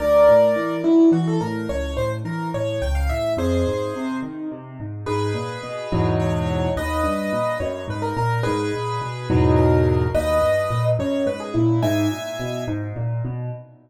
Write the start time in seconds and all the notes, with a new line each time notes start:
0.00 D2 A#4 D5
0.28 A2
0.56 E3
0.84 F#3 E4
1.12 E3 F#4
1.27 A4
1.41 A2 A#4
1.69 C#2 C#5
1.97 A2 C5
2.25 E3 A#4
2.54 A2 C#5
2.82 C#2 G5
2.95 F5
3.09 A2 E5
3.37 F2 G#4 C5
3.67 G#2
3.95 C3
4.23 D#3
4.52 C3
4.80 G#2
5.06 G#2 G#4 B4
5.34 A#2
5.63 B2
5.92 E2 G#2 B2 F#3
6.20 C#5
6.76 D#2 B4 D#5
7.03 G2
7.33 A#2
7.60 F#2 C#5
7.88 G#2 B4
8.02 A#4
8.17 A#2 A#4
8.43 G#2 G#4 B4
8.74 A#2
9.02 B2
9.30 E2 G#2 B2 F#3
9.56 A#4
10.14 D#2 B4 D#5
10.42 G2
10.70 A#2
10.99 F#2 C#5
11.26 G#2 B4
11.40 G#4
11.54 A#2 E4
11.83 G#2 E5 G#5
12.11 A#2
12.40 B2
12.68 G#2
12.96 A#2
13.25 B2